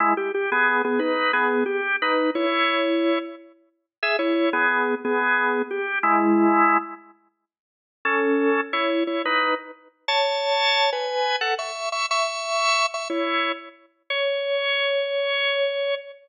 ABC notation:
X:1
M:12/8
L:1/8
Q:3/8=119
K:C#m
V:1 name="Drawbar Organ"
[G,E] =G G [B,^G]2 [B,G] [DB]2 [B,G]2 =G2 | [DB]2 [Ec]6 z4 | [Ge] [Ec]2 [B,G]3 [B,G]4 =G2 | [G,E]5 z7 |
[CA]4 [Ec]2 [Ec] [DB]2 z3 | [ca]5 [Bg]3 [Af] [ec']2 [ec'] | [ec']5 [ec'] [Ec]3 z3 | c12 |]